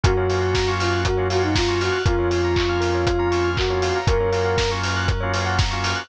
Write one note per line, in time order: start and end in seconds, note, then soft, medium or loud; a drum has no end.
0.04 1.90 F#2 medium
0.04 0.14 A#3 loud
0.04 0.14 C#4 loud
0.04 0.14 F4 loud
0.04 0.14 F#4 loud
0.04 0.71 F#4 loud
0.04 0.16 A#4 medium
0.04 kick loud
0.04 closed hi-hat loud
0.17 0.27 A#3 medium
0.17 0.27 C#4 loud
0.17 0.27 F4 medium
0.17 0.27 F#4 medium
0.17 0.28 C#5 medium
0.29 0.60 A#3 loud
0.29 0.60 C#4 loud
0.29 0.60 F4 medium
0.29 0.60 F#4 loud
0.29 0.41 F5 medium
0.29 open hi-hat medium
0.42 0.53 F#5 medium
0.55 0.66 A#5 medium
0.55 kick loud
0.55 snare loud
0.67 1.08 A#3 medium
0.67 1.08 C#4 loud
0.67 1.08 F4 loud
0.67 1.08 F#4 medium
0.67 0.79 C#6 medium
0.80 1.01 F4 loud
0.80 0.91 F6 medium
0.80 open hi-hat loud
0.92 1.03 F#6 medium
1.05 1.28 F#4 loud
1.05 1.17 A#4 medium
1.05 kick medium
1.05 closed hi-hat loud
1.17 1.28 A#3 loud
1.17 1.28 C#4 medium
1.17 1.28 F4 medium
1.17 1.28 F#4 medium
1.17 1.28 C#5 medium
1.30 1.61 A#3 medium
1.30 1.61 C#4 medium
1.30 1.61 F4 loud
1.30 1.43 F#4 loud
1.30 1.61 F#4 medium
1.30 1.42 F5 medium
1.30 open hi-hat medium
1.43 1.55 D#4 loud
1.43 1.54 F#5 medium
1.55 1.80 F4 loud
1.55 1.67 A#5 medium
1.55 kick loud
1.55 snare loud
1.68 1.98 A#3 medium
1.68 1.98 C#4 medium
1.68 1.98 F4 loud
1.68 1.98 F#4 loud
1.68 1.80 C#6 medium
1.80 2.01 F#4 medium
1.80 1.93 F6 medium
1.80 open hi-hat medium
1.92 2.04 F#6 medium
2.06 3.91 F2 medium
2.06 2.16 A#3 loud
2.06 2.16 C#4 loud
2.06 2.16 F4 loud
2.06 3.50 F4 loud
2.06 2.17 A#4 loud
2.06 kick loud
2.06 closed hi-hat loud
2.18 2.29 A#3 medium
2.18 2.29 C#4 medium
2.18 2.29 F4 medium
2.18 2.30 C#5 medium
2.30 2.61 A#3 medium
2.30 2.61 C#4 medium
2.30 2.61 F4 medium
2.30 2.42 F5 medium
2.30 open hi-hat medium
2.44 2.56 A#5 medium
2.56 2.68 C#6 medium
2.56 kick medium
2.56 clap loud
2.69 3.09 A#3 medium
2.69 3.09 C#4 medium
2.69 3.09 F4 loud
2.69 2.81 F6 medium
2.81 2.92 A#4 medium
2.81 open hi-hat medium
2.95 3.06 C#5 medium
3.07 3.18 F5 medium
3.07 kick loud
3.07 closed hi-hat loud
3.18 3.28 A#3 loud
3.18 3.28 C#4 medium
3.18 3.28 F4 medium
3.18 3.31 A#5 medium
3.31 3.61 A#3 medium
3.31 3.61 C#4 loud
3.31 3.61 F4 loud
3.31 3.43 C#6 medium
3.31 open hi-hat medium
3.44 3.56 F6 medium
3.57 3.99 F#4 loud
3.57 3.69 A#4 medium
3.57 kick loud
3.57 clap loud
3.70 4.00 A#3 loud
3.70 4.00 C#4 medium
3.70 4.00 F4 loud
3.70 3.81 C#5 medium
3.82 3.94 F5 medium
3.82 open hi-hat medium
3.96 4.07 A#5 medium
4.07 5.93 F#2 medium
4.07 4.18 A#3 loud
4.07 4.18 C#4 loud
4.07 4.18 F4 loud
4.07 4.18 F#4 loud
4.07 4.19 A#4 loud
4.07 4.71 A#4 loud
4.07 kick loud
4.07 closed hi-hat loud
4.20 4.30 A#3 loud
4.20 4.30 C#4 medium
4.20 4.30 F4 medium
4.20 4.30 F#4 loud
4.20 4.32 C#5 medium
4.32 4.63 A#3 loud
4.32 4.63 C#4 loud
4.32 4.63 F4 loud
4.32 4.63 F#4 loud
4.32 4.44 F5 medium
4.32 open hi-hat medium
4.45 4.56 F#5 medium
4.58 4.69 A#5 medium
4.58 kick loud
4.58 snare loud
4.71 5.12 A#3 medium
4.71 5.12 C#4 loud
4.71 5.12 F4 medium
4.71 5.12 F#4 medium
4.71 4.82 C#6 medium
4.83 4.95 F6 medium
4.83 open hi-hat medium
4.96 5.08 F#6 medium
5.08 5.19 A#4 medium
5.08 kick loud
5.08 closed hi-hat loud
5.20 5.33 A#3 loud
5.20 5.33 C#4 medium
5.20 5.33 F4 loud
5.20 5.33 F#4 loud
5.20 5.32 C#5 medium
5.34 5.64 A#3 loud
5.34 5.64 C#4 loud
5.34 5.64 F4 loud
5.34 5.64 F#4 medium
5.34 5.45 F5 medium
5.34 open hi-hat medium
5.46 5.57 F#5 medium
5.59 5.70 A#5 medium
5.59 kick loud
5.59 snare loud
5.71 6.03 A#3 loud
5.71 6.03 C#4 loud
5.71 6.03 F4 loud
5.71 6.03 F#4 medium
5.71 5.82 C#6 medium
5.84 5.96 F6 medium
5.84 open hi-hat medium
5.96 6.07 F#6 medium